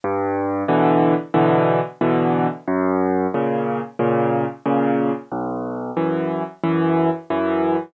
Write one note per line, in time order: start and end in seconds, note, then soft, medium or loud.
0.04 0.63 G2 medium
0.68 1.14 B2 medium
0.68 1.14 D3 medium
0.68 1.14 E3 medium
1.34 1.80 B2 medium
1.34 1.80 D3 medium
1.34 1.80 E3 medium
2.01 2.47 B2 medium
2.01 2.47 D3 medium
2.01 2.47 E3 medium
2.67 3.27 F#2 medium
3.34 3.80 A#2 medium
3.34 3.80 C#3 medium
3.99 4.45 A#2 medium
3.99 4.45 C#3 medium
4.66 5.12 A#2 medium
4.66 5.12 C#3 medium
5.31 5.91 B1 medium
5.97 6.43 F#2 medium
5.97 6.43 E3 medium
6.63 7.10 F#2 medium
6.63 7.10 E3 medium
7.30 7.76 F#2 medium
7.30 7.76 E3 medium